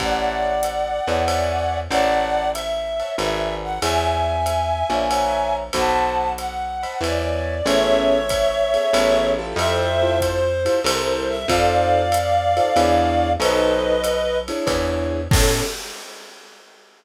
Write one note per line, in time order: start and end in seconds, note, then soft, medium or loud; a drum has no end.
0.00 1.00 A1 medium
0.00 0.52 C#5 medium
0.00 1.78 D5 medium
0.00 0.52 E5 loud
0.00 0.52 F#5 loud
0.00 1.78 F#5 medium
0.00 0.52 A5 medium
0.00 kick soft
0.00 ride medium
0.63 hi-hat pedal medium
0.63 ride medium
1.07 1.88 E2 medium
1.07 1.22 C#5 medium
1.07 1.22 E5 medium
1.07 1.22 F#5 medium
1.07 1.22 A5 medium
1.07 ride medium
1.28 1.80 C#5 loud
1.28 1.80 D5 medium
1.28 1.80 E5 medium
1.28 1.80 G#5 loud
1.28 ride medium
1.90 3.02 A1 medium
1.90 2.43 C#5 medium
1.90 2.50 D5 medium
1.90 2.43 E5 loud
1.90 2.50 F#5 loud
1.90 2.43 F#5 medium
1.90 2.43 A5 loud
1.90 ride medium
2.53 3.15 E5 medium
2.53 hi-hat pedal medium
2.53 ride medium
3.00 3.14 C#5 medium
3.00 3.14 E5 medium
3.00 3.14 F#5 medium
3.00 3.14 A5 medium
3.00 ride soft
3.18 3.79 G#1 medium
3.18 3.71 B4 loud
3.18 3.71 D5 medium
3.18 3.55 E5 medium
3.18 3.71 F#5 loud
3.18 3.71 G#5 loud
3.18 ride medium
3.64 3.81 F#5 medium
3.82 4.83 E2 loud
3.82 4.35 C#5 loud
3.82 4.35 D5 loud
3.82 5.55 E5 medium
3.82 4.35 E5 loud
3.82 5.55 G#5 medium
3.82 4.35 G#5 loud
3.82 ride medium
4.46 hi-hat pedal medium
4.46 ride medium
4.90 5.70 A#1 medium
4.90 5.05 C#5 medium
4.90 5.05 D5 medium
4.90 5.05 E5 medium
4.90 5.05 G#5 medium
4.90 ride medium
5.11 5.62 C#5 loud
5.11 5.62 E5 medium
5.11 5.62 F#5 loud
5.11 5.62 A#5 loud
5.11 ride medium
5.73 6.86 B1 medium
5.73 6.26 C5 loud
5.73 6.26 D#5 medium
5.73 6.32 F#5 medium
5.73 6.26 A5 loud
5.73 6.32 A5 medium
5.73 6.26 B5 loud
5.73 kick soft
5.73 ride medium
6.38 7.01 F#5 medium
6.38 hi-hat pedal medium
6.38 ride medium
6.83 6.97 C5 medium
6.83 6.97 D#5 medium
6.83 6.97 A5 medium
6.83 6.97 B5 medium
6.83 ride medium
7.01 7.61 E2 medium
7.01 7.54 C#5 loud
7.01 7.54 D5 loud
7.01 7.66 D5 medium
7.01 7.54 E5 medium
7.01 7.54 G#5 medium
7.01 ride medium
7.65 8.77 A1 loud
7.65 8.18 B3 loud
7.65 8.18 C#4 loud
7.65 8.18 G#4 loud
7.65 8.18 A4 loud
7.65 9.30 C#5 loud
7.65 9.30 E5 loud
7.65 ride medium
8.29 kick soft
8.29 hi-hat pedal medium
8.29 ride medium
8.74 8.88 B3 medium
8.74 8.88 C#4 loud
8.74 8.88 G#4 loud
8.74 8.88 A4 medium
8.74 ride medium
8.93 9.54 A1 loud
8.93 9.35 B3 loud
8.93 9.35 C#4 loud
8.93 9.35 G#4 loud
8.93 9.35 A4 loud
8.93 ride medium
9.38 9.89 E4 loud
9.38 9.89 F4 loud
9.38 9.89 G4 loud
9.38 9.89 A4 loud
9.56 10.68 F2 loud
9.56 10.19 C5 loud
9.56 10.19 E5 loud
9.56 ride medium
10.02 10.39 E4 loud
10.02 10.39 F4 loud
10.02 10.39 G4 loud
10.02 10.39 A4 loud
10.20 10.80 C5 loud
10.20 kick soft
10.20 hi-hat pedal medium
10.20 ride medium
10.65 10.79 E4 loud
10.65 10.79 F4 loud
10.65 10.79 G4 loud
10.65 10.79 A4 loud
10.65 ride medium
10.84 11.45 C2 loud
10.84 11.37 E4 loud
10.84 11.37 A4 loud
10.84 11.37 A#4 loud
10.84 11.28 C5 loud
10.84 11.37 C5 loud
10.84 ride loud
11.29 11.47 E5 loud
11.48 12.60 F2 loud
11.48 12.01 D#4 loud
11.48 12.01 F4 loud
11.48 12.01 A4 loud
11.48 12.01 C5 loud
11.48 13.31 D5 medium
11.48 13.31 F5 loud
11.48 kick medium
11.48 ride medium
12.12 hi-hat pedal medium
12.12 ride medium
12.56 12.70 D#4 loud
12.56 12.70 F4 medium
12.56 12.70 A4 loud
12.56 12.70 C5 loud
12.56 ride medium
12.76 13.37 E2 loud
12.76 13.29 D4 loud
12.76 13.29 E4 loud
12.76 13.29 G#4 loud
12.76 13.29 C#5 loud
12.76 ride medium
13.40 14.51 B1 loud
13.40 13.92 D#4 loud
13.40 13.92 A4 loud
13.40 13.92 B4 loud
13.40 14.38 B4 loud
13.40 13.92 C5 loud
13.40 14.38 D#5 loud
13.40 ride medium
14.04 hi-hat pedal medium
14.04 ride medium
14.48 15.20 D4 loud
14.48 15.20 E4 loud
14.48 15.20 G#4 loud
14.48 15.20 C#5 loud
14.48 ride medium
14.67 15.27 E2 loud
14.67 kick medium
14.67 ride medium
15.31 15.62 A2 loud
15.31 15.63 B3 loud
15.31 15.63 C#4 loud
15.31 15.63 G#4 medium
15.31 15.62 A4 loud
15.31 15.63 A4 loud
15.31 kick loud
15.31 crash loud